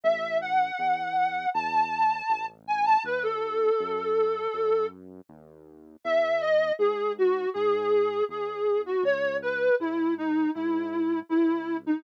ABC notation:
X:1
M:4/4
L:1/16
Q:1/4=80
K:C#m
V:1 name="Ocarina"
e2 f6 a6 g a | B A9 z6 | e2 d2 G2 F2 G4 G3 F | c2 B2 E2 D2 E4 E3 D |]
V:2 name="Synth Bass 1" clef=bass
A,,,4 E,,4 E,,4 A,,,4 | D,,4 F,,4 F,,4 D,,4 | E,,4 G,,4 G,,4 E,,4 | C,,4 G,,4 G,,4 C,,4 |]